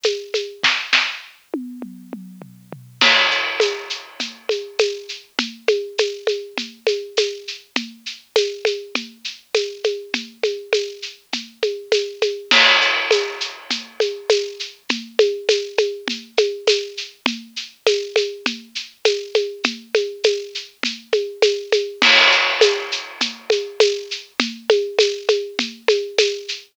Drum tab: CC |--|--------|x-------|--------|
TB |x-|--------|--x---x-|--x---x-|
SH |xx|--------|xxxxxxxx|xxxxxxxx|
SD |--|oo------|--------|--------|
T1 |--|---o----|--------|--------|
T2 |--|----oo--|--------|--------|
FT |--|------oo|--------|--------|
CG |oo|--------|O-o-Ooo-|OoooOoo-|
BD |--|o-------|--------|--------|

CC |--------|--------|x-------|--------|
TB |--x---x-|--x---x-|--x---x-|--x---x-|
SH |xxxxxxxx|xxxxxxxx|xxxxxxxx|xxxxxxxx|
SD |--------|--------|--------|--------|
T1 |--------|--------|--------|--------|
T2 |--------|--------|--------|--------|
FT |--------|--------|--------|--------|
CG |O-ooO-oo|Ooo-Oooo|O-o-Ooo-|OoooOoo-|
BD |--------|--------|--------|--------|

CC |--------|--------|x-------|--------|
TB |--x---x-|--x---x-|--x---x-|--x---x-|
SH |xxxxxxxx|xxxxxxxx|xxxxxxxx|xxxxxxxx|
SD |--------|--------|--------|--------|
T1 |--------|--------|--------|--------|
T2 |--------|--------|--------|--------|
FT |--------|--------|--------|--------|
CG |O-ooO-oo|Ooo-Oooo|O-o-Ooo-|OoooOoo-|
BD |--------|--------|--------|--------|